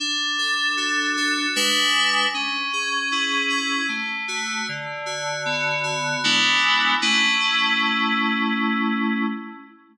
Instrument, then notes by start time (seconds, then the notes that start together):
electric piano 2
0.00 D4
0.38 A4
0.77 F#4
1.17 A4
1.56 G#3 D4 B4
2.34 C#4
2.73 G#4
3.12 E4
3.50 G#4
3.88 A3
4.28 F#4
4.69 D3
5.06 F#4
5.45 B3
5.84 F#4
6.24 G#3 B3 D4 E4
7.02 A3 C#4 E4